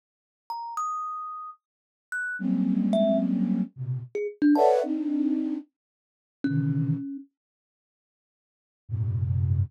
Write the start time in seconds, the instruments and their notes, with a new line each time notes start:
0.50 kalimba A#5
0.77 kalimba D#6
2.12 kalimba F#6
2.39 flute F#3 G3 G#3 A#3 C4 C#4
2.93 kalimba E5
3.76 flute A#2 B2 C3
4.15 kalimba G#4
4.42 kalimba D4
4.55 flute A4 B4 C#5 D5 E5 F#5, kalimba A5
4.83 flute C4 D4 D#4
6.44 flute B2 C3 C#3 D3 D#3 E3, kalimba C#4
8.89 flute F#2 G#2 A#2 C3